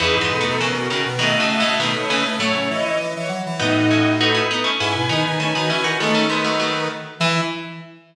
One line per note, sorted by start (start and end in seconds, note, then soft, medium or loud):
0.00 0.15 E2 medium
0.00 0.19 C#3 medium
0.00 0.19 E3 medium
0.00 0.57 D#4 loud
0.00 0.15 G#4 medium
0.00 0.57 B4 loud
0.15 0.30 G#2 medium
0.21 0.40 E3 medium
0.21 0.40 G#3 medium
0.31 0.45 B2 medium
0.31 0.45 A4 medium
0.41 0.60 F#3 medium
0.41 0.60 A3 medium
0.46 0.60 B2 medium
0.46 0.60 A4 medium
0.60 0.73 B2 medium
0.60 0.75 C#3 medium
0.60 0.75 E3 medium
0.60 1.09 C#4 medium
0.60 1.09 A#4 loud
0.73 0.88 B2 medium
0.73 0.89 F#4 medium
0.90 1.04 B2 medium
0.90 1.04 C#3 medium
0.90 1.04 D#3 medium
1.05 1.20 B2 medium
1.19 1.38 B2 medium
1.19 1.38 D#3 medium
1.19 1.35 A3 medium
1.19 1.75 F#4 loud
1.19 1.34 D#5 medium
1.19 1.75 D#5 loud
1.36 1.48 A3 medium
1.40 1.59 A2 medium
1.40 1.59 C#3 medium
1.49 1.63 A3 medium
1.49 1.63 E5 medium
1.60 1.79 A2 medium
1.60 1.79 C#3 medium
1.64 1.79 A3 medium
1.64 1.80 E5 medium
1.80 1.94 B2 medium
1.80 1.94 D#3 medium
1.80 1.95 A3 medium
1.80 2.36 D#4 medium
1.80 2.36 B4 medium
1.95 2.09 A3 medium
1.95 2.10 C#5 medium
2.10 2.24 C#3 medium
2.10 2.24 E3 medium
2.10 2.24 A3 medium
2.25 2.39 A3 medium
2.39 2.53 A2 medium
2.39 2.92 F#3 medium
2.39 2.92 A3 medium
2.39 2.98 E4 medium
2.39 2.53 C#5 loud
2.39 2.98 C#5 loud
2.54 2.68 C#3 medium
2.70 2.84 E3 medium
2.70 2.84 D#5 medium
2.85 2.99 E3 medium
2.85 2.99 D#5 medium
3.00 3.14 E3 medium
3.15 3.30 E3 medium
3.15 3.29 C#5 medium
3.28 3.43 F#3 medium
3.46 3.60 E3 medium
3.60 4.41 A2 medium
3.60 3.89 B3 medium
3.60 3.89 D#4 medium
3.60 4.13 D#4 loud
3.60 4.16 F#4 loud
3.60 4.16 D#5 loud
3.91 4.17 C#4 medium
3.91 4.17 E4 medium
4.18 4.70 D#4 loud
4.18 4.35 D#4 medium
4.18 4.35 F#4 medium
4.18 4.44 A4 medium
4.18 4.70 B4 loud
4.34 4.49 C#4 medium
4.34 4.49 E4 medium
4.51 4.65 B3 medium
4.51 4.65 D#4 medium
4.64 4.78 A3 medium
4.64 4.78 C#4 medium
4.79 4.95 G#2 medium
4.79 5.09 C#4 medium
4.79 4.93 E4 medium
4.79 5.09 E4 medium
4.79 5.39 B4 loud
4.79 5.39 G#5 loud
4.95 5.09 B2 medium
5.08 5.24 D#3 medium
5.08 5.37 B3 medium
5.08 5.23 D#4 medium
5.08 5.37 D#4 medium
5.24 5.38 D#3 medium
5.24 5.38 D#4 medium
5.39 5.53 D#3 medium
5.39 5.54 A3 medium
5.39 5.54 C#4 medium
5.39 5.97 B4 medium
5.39 5.97 G#5 loud
5.55 5.70 D#3 medium
5.55 5.69 B3 medium
5.55 5.69 D#4 medium
5.55 5.70 F#4 medium
5.70 5.84 E3 medium
5.70 5.84 C#4 medium
5.70 5.84 E4 medium
5.83 5.98 D#3 medium
5.83 5.98 D#4 medium
5.83 5.98 F#4 medium
5.99 6.88 D#3 medium
5.99 6.15 G#3 medium
5.99 6.24 A3 medium
5.99 6.15 B3 medium
5.99 6.27 C#4 loud
5.99 6.27 A4 loud
6.15 6.29 A3 medium
6.15 6.29 C#4 medium
6.29 6.44 G#3 medium
6.29 6.44 B3 medium
6.29 6.44 D#4 loud
6.29 6.44 B4 loud
6.45 6.59 F#3 medium
6.45 6.59 A3 medium
6.45 6.88 D#4 medium
6.45 6.88 B4 loud
6.60 7.11 F#3 medium
6.60 7.11 A3 medium
7.19 7.41 E3 loud
7.19 7.42 E3 loud
7.19 7.40 E4 loud
7.19 7.41 E5 loud